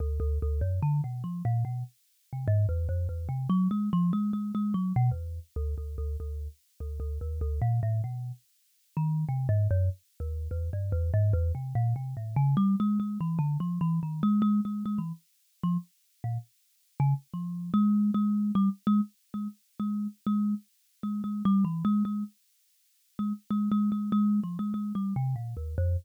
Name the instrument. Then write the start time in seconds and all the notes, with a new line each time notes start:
kalimba
0.00 D2
0.20 D2
0.42 D2
0.61 F#2
0.82 D3
1.04 B2
1.24 F3
1.45 A#2
1.65 B2
2.33 C3
2.48 G#2
2.69 E2
2.89 F2
3.09 E2
3.29 C3
3.49 F#3
3.71 G#3
3.93 F3
4.13 G#3
4.33 G#3
4.55 G#3
4.74 F#3
4.96 B2
5.11 E2
5.56 D2
5.78 D2
5.98 D2
6.20 D2
6.80 D2
7.00 D2
7.21 D#2
7.41 D2
7.62 A#2
7.83 A2
8.04 B2
8.97 D#3
9.29 C3
9.49 G#2
9.71 F#2
10.20 D#2
10.51 E2
10.73 G2
10.92 E2
11.14 G#2
11.33 E2
11.55 C3
11.75 A#2
11.96 C3
12.17 A2
12.36 C#3
12.57 G3
12.80 G#3
13.00 G#3
13.21 E3
13.39 D3
13.60 F3
13.81 E3
14.03 D#3
14.23 G#3
14.42 G#3
14.65 G#3
14.86 G#3
14.98 E3
15.64 F3
16.24 A#2
17.00 C#3
17.34 F3
17.74 G#3
18.14 G#3
18.55 G3
18.87 G#3
19.34 G#3
19.80 G#3
20.27 G#3
21.03 G#3
21.24 G#3
21.45 G3
21.65 E3
21.85 G#3
22.05 G#3
23.19 G#3
23.51 G#3
23.72 G#3
23.92 G#3
24.12 G#3
24.44 F3
24.59 G#3
24.74 G#3
24.95 G3
25.16 C3
25.36 A#2
25.57 D#2
25.78 F2